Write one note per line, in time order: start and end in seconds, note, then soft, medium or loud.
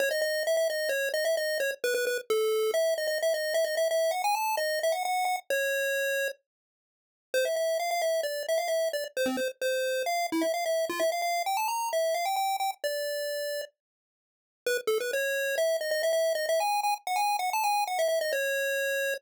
0.00 0.09 C#5 loud
0.11 0.21 D#5 medium
0.22 0.43 D#5 medium
0.47 0.56 E5 medium
0.57 0.68 E5 medium
0.70 0.89 D#5 medium
0.89 1.09 C#5 medium
1.14 1.25 D#5 medium
1.25 1.36 E5 medium
1.37 1.58 D#5 medium
1.60 1.71 C#5 medium
1.84 1.94 B4 medium
1.94 2.05 B4 medium
2.07 2.18 B4 medium
2.30 2.71 A4 medium
2.74 2.94 E5 medium
2.98 3.07 D#5 medium
3.07 3.18 D#5 medium
3.22 3.33 E5 medium
3.34 3.54 D#5 medium
3.54 3.65 E5 medium
3.65 3.75 D#5 loud
3.77 3.88 E5 medium
3.91 4.11 E5 loud
4.11 4.22 F#5 medium
4.24 4.35 G#5 medium
4.35 4.56 A5 medium
4.57 4.79 D#5 medium
4.83 4.94 E5 medium
4.92 5.03 F#5 medium
5.05 5.25 F#5 medium
5.25 5.36 F#5 medium
5.50 6.28 C#5 loud
7.34 7.45 C5 medium
7.45 7.56 E5 medium
7.56 7.78 E5 medium
7.79 7.90 F5 medium
7.91 8.02 F5 medium
8.02 8.21 E5 medium
8.23 8.43 D5 medium
8.48 8.59 E5 medium
8.58 8.69 F5 medium
8.68 8.89 E5 medium
8.93 9.04 D5 medium
9.17 9.28 C5 medium
9.26 9.37 C4 medium
9.37 9.48 C5 medium
9.62 10.03 C5 medium
10.06 10.27 F5 medium
10.32 10.43 E4 medium
10.42 10.52 E5 medium
10.54 10.65 F5 medium
10.66 10.85 E5 medium
10.89 11.00 F4 medium
11.00 11.10 E5 medium
11.12 11.22 F5 medium
11.22 11.43 F5 medium
11.46 11.57 G5 medium
11.57 11.68 A5 medium
11.68 11.89 A#5 medium
11.93 12.15 E5 medium
12.14 12.25 F5 medium
12.25 12.36 G5 medium
12.36 12.56 G5 medium
12.60 12.71 G5 medium
12.84 13.61 D5 medium
14.66 14.77 B4 medium
14.87 14.98 A4 medium
15.00 15.11 B4 medium
15.13 15.56 C#5 medium
15.58 15.77 E5 medium
15.81 15.91 D#5 medium
15.91 16.02 D#5 medium
16.03 16.12 E5 medium
16.13 16.33 E5 medium
16.35 16.46 D#5 medium
16.49 16.60 E5 medium
16.60 16.81 G#5 medium
16.83 16.94 G#5 medium
17.07 17.18 F#5 medium
17.16 17.37 G#5 medium
17.39 17.50 F#5 medium
17.53 17.64 A5 medium
17.64 17.84 G#5 medium
17.87 17.98 F#5 medium
17.99 18.08 E5 medium
18.08 18.19 E5 medium
18.21 18.32 D#5 medium
18.33 19.14 C#5 medium